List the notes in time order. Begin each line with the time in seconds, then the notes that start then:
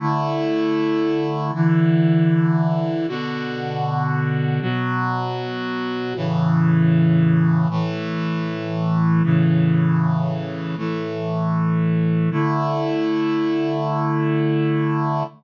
0.00 D3 A3 E4
1.54 D3 E3 E4
3.08 B2 D3 F#4
4.61 B2 F#3 F#4
6.16 A2 C#3 E3
7.70 A2 E3 A3
9.23 A2 C#3 E3
10.77 A2 E3 A3
12.31 D3 A3 E4